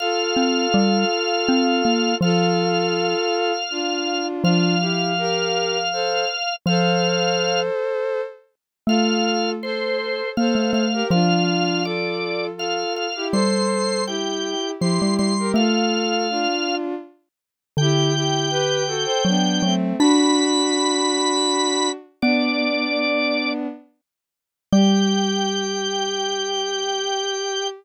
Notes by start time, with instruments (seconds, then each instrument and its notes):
0.00 violin F4 A4, drawbar organ F5
0.36 xylophone C4
0.74 xylophone G3
1.49 xylophone C4
1.85 xylophone A#3
2.21 xylophone F3, violin F4 A4, drawbar organ F5
3.71 violin D4 F4
4.44 xylophone F3, violin D4 F4, drawbar organ F5
4.80 violin E4 G4
5.18 violin G4 A#4
5.93 violin A4 C5
6.66 xylophone F3, violin A4 C5, drawbar organ F5
8.87 xylophone A3, violin F4 A4, drawbar organ F5
9.63 violin A4 C5, drawbar organ C5
10.37 xylophone A#3, violin A4 C5, drawbar organ F5
10.55 xylophone A3
10.73 xylophone A3, drawbar organ F5
10.93 violin G4 A#4
11.10 xylophone F3, violin D4 F4, drawbar organ F5
11.84 violin F4 A4, drawbar organ D5
12.57 violin F4 A4, drawbar organ F5
12.96 drawbar organ F5
13.16 violin E4 G4
13.32 xylophone G3, violin A4 C5, drawbar organ C6
14.07 violin E4 G4, drawbar organ G5
14.80 xylophone F3, violin E4 G4, drawbar organ C6
15.02 xylophone G3
15.19 xylophone G3, drawbar organ C6
15.39 violin G4 A#4
15.54 xylophone A3, violin F4 A4, drawbar organ F5
16.30 violin D4 F4
17.77 xylophone D3, violin E4 G4, drawbar organ G5
18.15 violin E4 G4
18.51 violin G4 B4
18.87 violin F#4 A4
19.05 violin A4 C5
19.25 xylophone F#3, violin B3 D4
19.63 xylophone F#3, violin A3 C4
19.99 violin D4 F#4, xylophone D4, drawbar organ B5
22.22 xylophone B3, violin B3 D4, drawbar organ D5
24.72 xylophone G3, violin G4, drawbar organ G5